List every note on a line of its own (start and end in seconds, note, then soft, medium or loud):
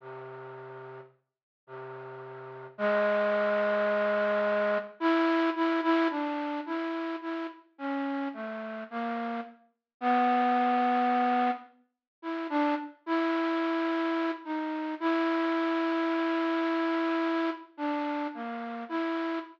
0.00 1.00 C3 medium
1.67 2.67 C3 medium
2.78 4.78 G#3 loud
5.00 5.50 E4 loud
5.56 5.81 E4 medium
5.83 6.08 E4 loud
6.10 6.60 D4 medium
6.66 7.16 E4 medium
7.22 7.47 E4 medium
7.78 8.28 C#4 medium
8.34 8.84 A3 medium
8.91 9.41 A#3 medium
10.01 11.51 B3 loud
12.22 12.47 E4 medium
12.50 12.75 D4 medium
13.06 14.31 E4 medium
14.45 14.95 D#4 medium
15.00 17.50 E4 medium
17.77 18.27 D4 medium
18.34 18.84 A#3 medium
18.89 19.39 E4 medium